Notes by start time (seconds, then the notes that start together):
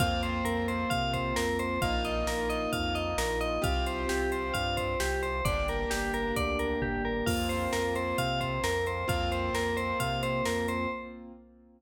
0.00 F2 A#3 C4 F4 F5, kick, closed hi-hat
0.23 C5, closed hi-hat
0.44 F2 A#4, closed hi-hat
0.68 C5, closed hi-hat
0.90 C3 F5, kick, closed hi-hat
1.13 C5, kick, closed hi-hat
1.36 F2 A#4, snare
1.59 C5, closed hi-hat
1.82 A#1 A#3 D#4 F4 F5, kick, closed hi-hat
2.05 D#5, closed hi-hat
2.26 A#1 A#4, snare
2.50 D#5, closed hi-hat
2.73 F2 F5, kick, closed hi-hat
2.95 D#5, closed hi-hat
3.18 A#1 A#4, snare
3.41 D#5, closed hi-hat
3.62 C2 C4 F4 G4 F5, kick, closed hi-hat
3.86 C5, closed hi-hat
4.09 C2 G4, snare
4.32 C5, closed hi-hat
4.54 G2 F5, kick, closed hi-hat
4.77 C5, kick, closed hi-hat
5.00 C2 G4, snare
5.23 C5, closed hi-hat
5.45 G1 A#3 D4 G4 D5, kick, closed hi-hat
5.68 A#4, closed hi-hat
5.90 G1 G4, snare
6.14 A#4, closed hi-hat
6.36 D2 D5, kick, closed hi-hat
6.59 A#4, closed hi-hat
6.82 G1 G4, kick, floor tom
7.05 A#4
7.26 F2 A#3 C4 F4 F5, kick, crash
7.49 C5, closed hi-hat
7.73 F2 A#4, snare
7.95 C5, closed hi-hat
8.18 C3 F5, kick, closed hi-hat
8.41 C5, kick, closed hi-hat
8.64 F2 A#4, snare
8.86 C5, closed hi-hat
9.08 F2 A#3 C4 F4 F5, kick, closed hi-hat
9.32 C5, closed hi-hat
9.53 F2 A#4, snare, closed hi-hat
9.77 C5, closed hi-hat
10.00 C3 F5, kick, closed hi-hat
10.23 C5, closed hi-hat
10.45 F2 A#4, snare
10.68 C5, closed hi-hat